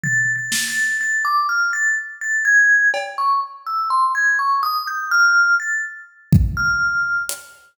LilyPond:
<<
  \new Staff \with { instrumentName = "Vibraphone" } { \time 4/4 \tempo 4 = 62 \tuplet 3/2 { a'''8 a'''8 a'''8 } a'''16 d'''16 f'''16 a'''16 r16 a'''16 gis'''8 r16 cis'''16 r16 e'''16 | c'''16 gis'''16 cis'''16 dis'''16 g'''16 f'''8 a'''16 r8. f'''8. r8 | }
  \new DrumStaff \with { instrumentName = "Drums" } \drummode { \time 4/4 tomfh8 sn8 r4 r4 cb4 | r4 r4 r8 bd8 r8 hh8 | }
>>